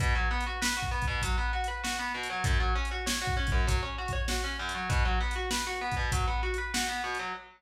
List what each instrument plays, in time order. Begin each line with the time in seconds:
0.00 overdriven guitar B2, kick, closed hi-hat
0.15 overdriven guitar F#3
0.31 overdriven guitar B3
0.41 closed hi-hat
0.46 overdriven guitar F#4
0.62 overdriven guitar B4, snare
0.77 overdriven guitar F#4
0.82 kick
0.91 overdriven guitar B3
1.02 kick, closed hi-hat
1.08 overdriven guitar B2
1.22 overdriven guitar F#3, kick, closed hi-hat
1.38 overdriven guitar B3
1.53 overdriven guitar F#4
1.64 overdriven guitar B4, closed hi-hat
1.84 overdriven guitar F#4, snare
1.99 overdriven guitar B3
2.14 overdriven guitar B2
2.23 closed hi-hat
2.30 overdriven guitar F#3
2.44 overdriven guitar F#2, kick, closed hi-hat
2.60 overdriven guitar F#3
2.76 overdriven guitar C#4
2.85 closed hi-hat
2.91 overdriven guitar F#4
3.06 overdriven guitar C#5, snare
3.22 overdriven guitar F#4
3.27 kick
3.37 overdriven guitar C#4
3.47 kick, closed hi-hat
3.52 overdriven guitar F#2
3.67 overdriven guitar F#3, kick, closed hi-hat
3.83 overdriven guitar C#4
3.98 overdriven guitar F#4
4.08 kick, closed hi-hat
4.13 overdriven guitar C#5
4.28 overdriven guitar F#4, snare
4.44 overdriven guitar C#4
4.59 overdriven guitar F#2
4.69 closed hi-hat
4.75 overdriven guitar F#3
4.89 overdriven guitar B2, kick, closed hi-hat
5.05 overdriven guitar F#3
5.21 overdriven guitar B3
5.31 closed hi-hat
5.36 overdriven guitar F#4
5.51 overdriven guitar B4, snare
5.67 overdriven guitar F#4
5.81 overdriven guitar B3
5.92 kick, closed hi-hat
5.97 overdriven guitar B2
6.12 overdriven guitar F#3, kick, closed hi-hat
6.27 overdriven guitar B3
6.43 overdriven guitar F#4
6.54 closed hi-hat
6.58 overdriven guitar B4
6.74 overdriven guitar F#4, snare
6.89 overdriven guitar B3
7.04 overdriven guitar B2
7.15 closed hi-hat
7.19 overdriven guitar F#3